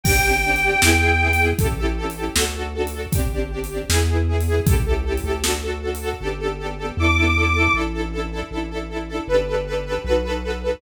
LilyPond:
<<
  \new Staff \with { instrumentName = "Accordion" } { \time 2/2 \key g \lydian \tempo 2 = 78 g''1 | r1 | r1 | r1 |
r2 d'''2 | r1 | r1 | }
  \new Staff \with { instrumentName = "String Ensemble 1" } { \time 2/2 \key g \lydian <c' d' g'>8 <c' d' g'>8 <c' d' g'>8 <c' d' g'>8 <b e' gis'>8 <b e' gis'>8 <b e' gis'>8 <b e' gis'>8 | <cis' e' g' a'>8 <cis' e' g' a'>8 <cis' e' g' a'>8 <cis' e' g' a'>8 <d' fis' a'>8 <d' fis' a'>8 <d' fis' a'>8 <d' fis' a'>8 | <c' d' g'>8 <c' d' g'>8 <c' d' g'>8 <c' d' g'>8 <b e' gis'>8 <b e' gis'>8 <b e' gis'>8 <b e' gis'>8 | <cis' e' g' a'>8 <cis' e' g' a'>8 <cis' e' g' a'>8 <cis' e' g' a'>8 <d' fis' a'>8 <d' fis' a'>8 <d' fis' a'>8 <d' fis' a'>8 |
<b d' g' a'>8 <b d' g' a'>8 <b d' g' a'>8 <b d' g' a'>8 <b d' e' a'>8 <b d' e' a'>8 <b d' e' a'>8 <b d' e' a'>8 | <d' e' a'>8 <d' e' a'>8 <d' e' a'>8 <d' e' a'>8 <d' e' a'>8 <d' e' a'>8 <d' e' a'>8 <d' e' a'>8 | <d' g' a' b'>8 <d' g' a' b'>8 <d' g' a' b'>8 <d' g' a' b'>8 <dis' fis' a' b'>8 <dis' fis' a' b'>8 <dis' fis' a' b'>8 <dis' fis' a' b'>8 | }
  \new Staff \with { instrumentName = "Synth Bass 1" } { \clef bass \time 2/2 \key g \lydian g,,2 e,2 | a,,2 d,2 | g,,2 e,2 | cis,4. d,2~ d,8 |
g,,2 e,2 | a,,2 a,,2 | g,,2 b,,2 | }
  \new DrumStaff \with { instrumentName = "Drums" } \drummode { \time 2/2 \tuplet 3/2 { <cymc bd>8 r8 r8 r8 hh8 r8 sn8 r8 r8 r8 hh8 r8 } | \tuplet 3/2 { <hh bd>8 r8 r8 r8 hh8 r8 sn8 r8 r8 r8 hh8 r8 } | \tuplet 3/2 { <hh bd>8 r8 r8 r8 hh8 r8 sn8 r8 r8 r8 hh8 r8 } | \tuplet 3/2 { <hh bd>8 r8 r8 r8 hh8 r8 sn8 r8 r8 r8 hh8 r8 } |
r2 r2 | r2 r2 | r2 r2 | }
>>